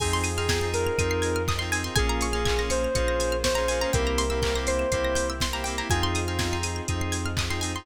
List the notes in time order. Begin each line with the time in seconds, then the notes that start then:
0.00 F2 C4 D#4 F4 G#4 G#5, kick, crash
0.13 C6
0.24 D#6, open hi-hat
0.37 C4 D#4 F4 G#4 F6
0.49 C4 D#4 F4 G#4 G#6, kick, snare
0.61 C4 D#4 F4 G#4 C7
0.74 A#4 D#7, open hi-hat
0.87 F7
0.98 F2 C4 D#4 F4 G#4 D#7, kick, closed hi-hat
1.11 C7
1.22 G#6, open hi-hat
1.36 F6
1.48 D#6, kick, clap
1.59 C4 D#4 F4 G#4 C6
1.72 C4 D#4 F4 G#4 G#5, open hi-hat
1.84 C4 D#4 F4 G#4 C6
1.96 A#1 A#3 C#4 F4 G#4 G#5, kick, closed hi-hat
2.09 A#5
2.21 C#6, open hi-hat
2.33 A#3 C#4 F4 G#4 F6
2.45 A#3 C#4 F4 G#4 G#6, kick, clap
2.58 A#3 C#4 F4 G#4 A#6
2.70 C5 C#7, open hi-hat
2.84 F7
2.95 A#1 A#3 C#4 F4 G#4 C#7, kick, closed hi-hat
3.08 A#6
3.20 G#6, open hi-hat
3.32 F6
3.44 C5 C#6, kick, snare
3.55 A#3 C#4 F4 G#4 A#5
3.68 A#3 C#4 F4 G#4 G#5, open hi-hat
3.81 A#3 C#4 F4 G#4 A#5
3.93 C2 A#3 C4 E4 G4 A#4 G5, kick, closed hi-hat
4.07 A#5
4.18 C6, open hi-hat
4.30 A#3 C4 E4 G4 E6
4.42 A#3 C4 E4 G4 G6, kick, clap
4.55 A#3 C4 E4 G4 A#6
4.67 C5 C7, open hi-hat
4.79 E7
4.91 C2 A#3 C4 E4 G4 C7, kick, closed hi-hat
5.05 A#6
5.15 G6, open hi-hat
5.30 E6
5.40 C6, kick, snare
5.53 A#3 C4 E4 G4 A#5
5.64 A#3 C4 E4 G4 G5, open hi-hat
5.78 A#3 C4 E4 G4 A#5
5.90 F2 C4 D#4 F4 G#4 G#5, kick, closed hi-hat
6.03 C6
6.15 D#6, open hi-hat
6.27 C4 D#4 F4 G#4 F6
6.39 C4 D#4 F4 G#4 G#6, kick, snare
6.51 C4 D#4 F4 G#4 C7
6.63 D#7, open hi-hat
6.76 F7
6.88 F2 C4 D#4 F4 G#4 D#7, kick, closed hi-hat
7.01 C7
7.12 G#6, open hi-hat
7.26 F6
7.37 D#6, kick, clap
7.49 C4 D#4 F4 G#4 C6
7.61 C4 D#4 F4 G#4 G#5, open hi-hat
7.75 C4 D#4 F4 G#4 C6